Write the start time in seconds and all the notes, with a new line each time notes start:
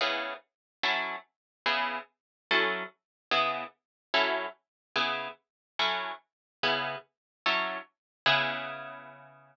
0.01 C#3 B3 E4 G#4
0.83 F#3 C#4 E4 A4
1.66 C#3 B3 E4 G#4
2.51 F#3 C#4 E4 A4
3.31 C#3 B3 E4 G#4
4.14 F#3 C#4 E4 A4
4.96 C#3 B3 E4 G#4
5.79 F#3 C#4 E4 A4
6.63 C#3 B3 E4 G#4
7.46 F#3 C#4 E4 A4
8.26 C#3 B3 E4 G#4